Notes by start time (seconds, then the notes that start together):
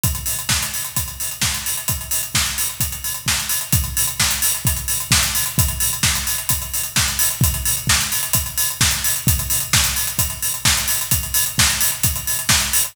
0.03 kick, closed hi-hat
0.15 closed hi-hat
0.26 open hi-hat
0.39 closed hi-hat
0.49 kick, snare
0.62 closed hi-hat
0.74 open hi-hat
0.85 closed hi-hat
0.96 kick, closed hi-hat
1.08 closed hi-hat
1.20 open hi-hat
1.31 closed hi-hat
1.41 kick, snare
1.54 closed hi-hat
1.66 open hi-hat
1.77 closed hi-hat
1.88 kick, closed hi-hat
2.01 closed hi-hat
2.11 open hi-hat
2.23 closed hi-hat
2.35 kick, snare
2.46 closed hi-hat
2.58 open hi-hat
2.69 closed hi-hat
2.80 kick, closed hi-hat
2.92 closed hi-hat
3.04 open hi-hat
3.14 closed hi-hat
3.26 kick, snare
3.40 closed hi-hat
3.49 open hi-hat
3.61 closed hi-hat
3.72 kick, closed hi-hat
3.84 closed hi-hat
3.97 open hi-hat
4.07 closed hi-hat
4.20 kick, snare
4.31 closed hi-hat
4.42 open hi-hat
4.54 closed hi-hat
4.65 kick, closed hi-hat
4.76 closed hi-hat
4.88 open hi-hat
5.00 closed hi-hat
5.11 kick, snare
5.23 closed hi-hat
5.35 open hi-hat
5.46 closed hi-hat
5.58 kick, closed hi-hat
5.68 closed hi-hat
5.80 open hi-hat
5.93 closed hi-hat
6.03 kick, snare
6.15 closed hi-hat
6.27 open hi-hat
6.38 closed hi-hat
6.49 kick, closed hi-hat
6.62 closed hi-hat
6.74 open hi-hat
6.83 closed hi-hat
6.96 kick, snare
7.08 closed hi-hat
7.19 open hi-hat
7.30 closed hi-hat
7.41 kick, closed hi-hat
7.54 closed hi-hat
7.65 open hi-hat
7.77 closed hi-hat
7.87 kick, snare
8.01 closed hi-hat
8.12 open hi-hat
8.23 closed hi-hat
8.33 kick, closed hi-hat
8.46 closed hi-hat
8.57 open hi-hat
8.70 closed hi-hat
8.81 kick, snare
8.91 closed hi-hat
9.04 open hi-hat
9.16 closed hi-hat
9.27 kick, closed hi-hat
9.39 closed hi-hat
9.50 open hi-hat
9.60 closed hi-hat
9.73 kick, snare
9.84 closed hi-hat
9.96 open hi-hat
10.07 closed hi-hat
10.19 kick, closed hi-hat
10.30 closed hi-hat
10.42 open hi-hat
10.54 closed hi-hat
10.65 kick, snare
10.77 closed hi-hat
10.88 open hi-hat
11.01 closed hi-hat
11.11 kick, closed hi-hat
11.23 closed hi-hat
11.34 open hi-hat
11.46 closed hi-hat
11.58 kick, snare
11.70 closed hi-hat
11.81 open hi-hat
11.92 closed hi-hat
12.03 kick, closed hi-hat
12.16 closed hi-hat
12.27 open hi-hat
12.39 closed hi-hat
12.49 kick, snare
12.60 closed hi-hat
12.73 open hi-hat
12.84 closed hi-hat